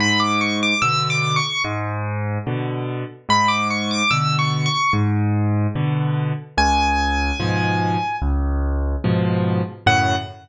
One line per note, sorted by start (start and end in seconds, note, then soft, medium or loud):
0.00 0.74 G#2 loud
0.00 0.20 B5 medium
0.20 0.39 D6 medium
0.41 0.60 C#6 medium
0.63 0.82 D6 medium
0.82 1.40 B2 medium
0.82 1.40 D3 medium
0.82 1.08 E6 medium
1.10 1.36 D6 medium
1.36 1.62 C#6 medium
1.64 2.38 G#2 loud
2.47 3.04 B2 medium
2.47 3.04 D3 medium
3.29 4.03 G#2 loud
3.29 3.49 B5 medium
3.48 3.68 D6 medium
3.70 3.90 C#6 medium
3.91 4.11 D6 medium
4.11 4.68 B2 medium
4.11 4.68 D3 medium
4.11 4.37 E6 medium
4.39 4.65 C#6 medium
4.66 4.92 C#6 medium
4.93 5.67 G#2 loud
5.75 6.33 B2 medium
5.75 6.33 D3 medium
6.58 7.32 C#2 loud
6.58 8.16 G#5 medium
7.40 7.97 G#2 medium
7.40 7.97 B2 medium
7.40 7.97 F3 medium
8.22 8.96 C#2 medium
9.04 9.62 G#2 medium
9.04 9.62 B2 medium
9.04 9.62 F3 medium
9.86 10.15 F#2 loud
9.86 10.15 A2 loud
9.86 10.15 C#3 medium
9.86 10.16 F#5 loud